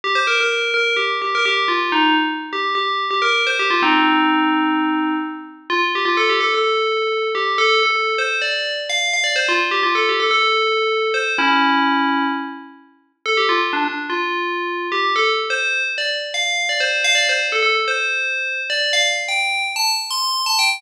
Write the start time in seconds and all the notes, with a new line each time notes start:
0.04 G4
0.15 C5
0.27 A#4
0.41 A#4
0.74 A#4
0.97 G4
1.22 G4
1.35 A#4
1.45 G4
1.68 F4
1.92 D#4
2.53 G4
2.75 G4
3.11 G4
3.22 A#4
3.47 C5
3.59 G4
3.70 F4
3.82 C4 D#4
5.70 F4
5.95 G4
6.05 F4
6.17 A4
6.30 G4
6.41 A4
6.54 A4
7.35 G4
7.58 A4
7.83 A4
8.18 C5
8.42 D5
8.90 F5
9.13 F5
9.24 D5
9.36 C5
9.49 F4
9.71 G4
9.83 F4
9.95 A4
10.09 G4
10.20 A4
10.31 A4
11.14 C5
11.38 C#4 E4
13.26 A4
13.37 G4
13.49 F4
13.73 D4
13.85 D4
14.10 F4
14.92 G4
15.16 A4
15.50 C5
15.98 D5
16.34 F5
16.69 D5
16.80 C5
17.04 F5
17.15 D5
17.29 C5
17.52 A4
17.63 A4
17.88 C5
18.70 D5
18.93 F5
19.28 G5
19.76 A5
20.11 C6
20.46 A5
20.59 G5